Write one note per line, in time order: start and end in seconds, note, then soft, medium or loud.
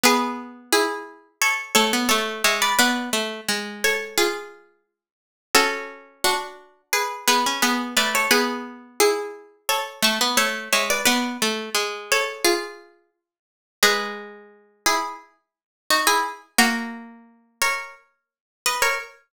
0.03 1.17 B3 medium
0.03 0.61 G#4 loud
0.03 0.61 B4 loud
0.72 1.29 E4 medium
0.72 1.29 G#4 loud
1.42 1.72 A4 medium
1.42 1.72 C#5 loud
1.75 1.92 A3 medium
1.75 2.05 A4 medium
1.75 2.05 C#5 loud
1.93 2.09 B3 medium
2.09 2.42 A3 medium
2.09 2.42 A4 medium
2.09 2.42 C#5 medium
2.44 2.73 G#3 medium
2.44 2.61 C#5 medium
2.44 2.61 E5 medium
2.62 2.78 B4 medium
2.62 2.78 D5 medium
2.79 3.10 B3 medium
2.79 3.63 B4 loud
2.79 3.63 D5 loud
3.13 3.41 A3 medium
3.48 4.99 G#3 medium
3.84 4.17 A4 medium
3.84 4.17 C#5 loud
4.18 4.83 F4 medium
4.18 4.83 G#4 loud
5.55 6.66 C#4 medium
5.55 6.21 F#4 medium
5.55 6.21 A4 loud
6.24 6.81 D4 medium
6.24 6.81 F#4 medium
6.93 7.25 G#4 medium
6.93 7.25 B4 medium
7.27 7.44 B3 medium
7.27 7.59 G#4 medium
7.27 7.59 B4 loud
7.46 7.63 C#4 medium
7.62 7.95 B3 medium
7.62 7.91 G#4 medium
7.62 7.91 B4 medium
7.97 8.27 A3 medium
7.97 8.13 B4 medium
7.97 8.13 D5 loud
8.15 8.31 A4 medium
8.15 8.31 C#5 medium
8.31 9.44 B3 medium
8.31 8.86 G#4 loud
8.31 8.86 B4 loud
9.00 9.56 E4 medium
9.00 9.56 G#4 loud
9.69 10.00 A4 medium
9.69 10.00 C#5 loud
10.02 10.19 A3 medium
10.02 10.34 A5 medium
10.02 10.34 C#6 loud
10.21 10.37 B3 medium
10.37 10.69 A3 medium
10.37 10.71 A4 medium
10.37 10.71 C#5 medium
10.73 11.01 G#3 medium
10.73 10.89 C#5 medium
10.73 10.89 E5 medium
10.90 11.05 B4 medium
10.90 11.05 D5 medium
11.05 11.37 B3 medium
11.05 11.90 B4 loud
11.05 11.90 D5 loud
11.42 11.70 A3 medium
11.74 13.25 G#3 medium
12.12 12.45 A4 medium
12.12 12.45 C#5 loud
12.44 13.10 F4 medium
12.44 13.10 G#4 loud
13.83 16.21 G#3 medium
13.83 14.83 G#4 medium
13.83 14.83 B4 loud
14.86 15.14 E4 medium
14.86 15.14 G#4 loud
15.90 16.07 D#4 medium
15.90 16.07 F#4 medium
16.07 16.23 E4 medium
16.07 16.23 G#4 loud
16.58 18.99 A#3 medium
16.58 17.43 F#4 medium
16.58 17.43 A#4 loud
17.61 17.95 A#4 medium
17.61 17.95 C#5 medium
18.66 18.82 B4 medium
18.66 18.82 D#5 medium
18.82 18.98 A#4 medium
18.82 18.98 C#5 loud